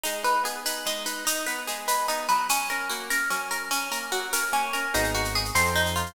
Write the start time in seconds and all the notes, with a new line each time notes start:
0.03 G#3 D#4, shaker
0.23 D#4 B4, shaker
0.44 B3 G#4, shaker
0.65 D#4 B4, shaker
0.85 G#3 D#4, shaker
1.06 D#4 B4, shaker
1.25 D#4, shaker
1.46 B3 B4, shaker
1.67 G#3 G#4, shaker
1.88 D#4 B4, shaker
2.08 B3 D#4, shaker
2.29 F#3 B4, shaker
2.49 C#4, shaker
2.70 C#4 A#4, shaker
2.89 A#3 F#4, shaker
3.10 C#4 A#4, shaker
3.30 F#3 C#4, shaker
3.50 C#4 A#4, shaker
3.71 C#4, shaker
3.91 A#3 A#4, shaker
4.12 F#3 F#4, shaker
4.33 C#4 A#4, shaker
4.52 A#3 C#4, shaker
4.73 C#4 A#4, shaker
4.94 G#1 B3 D#4 F#4 G#4, shaker
5.04 shaker
5.14 F#4, shaker
5.25 shaker
5.35 G#4, shaker
5.45 shaker
5.55 F2 C4 D#4 F4 A4 C5, shaker
5.65 shaker
5.76 D#4, shaker
5.86 shaker
5.96 F4, shaker
6.06 shaker